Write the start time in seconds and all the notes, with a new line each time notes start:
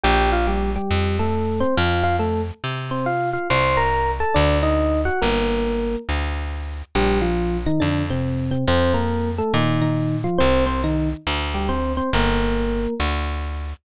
0.04 A#1 G4 G5
0.32 F4 F5
0.47 G3 G4
0.76 G3 G4
0.91 F2
1.19 A3 A4
1.60 C4 C5
1.77 F2 F4 F5
2.04 F4 F5
2.19 A3 A4
2.64 C3
2.91 C4 C5
3.06 F4 F5
3.33 F4 F5
3.50 C2 C5 C6
3.77 A#4 A#5
4.20 A4 A5
4.34 D2 D4 D5
4.63 D#4 D#5
5.05 F#4 F#5
5.22 G1 A#3 A#4
6.09 D2
6.95 A#1 G3 G4
7.21 F3 F4
7.66 D#3 D#4
7.80 F2 D3 D4
8.10 C3 C4
8.51 C3 C4
8.67 F2 C4 C5
8.94 A#3 A#4
9.38 A3 A4
9.54 A#2 D#3 D#4
9.81 D#3 D#4
10.24 F3 F4
10.38 C2 C4 C5
10.66 C4 C5
10.84 D#3 D#4
11.27 D2
11.54 G3 G4
11.69 C4 C5
11.97 C4 C5
12.13 G1 A#3 A#4
13.00 D2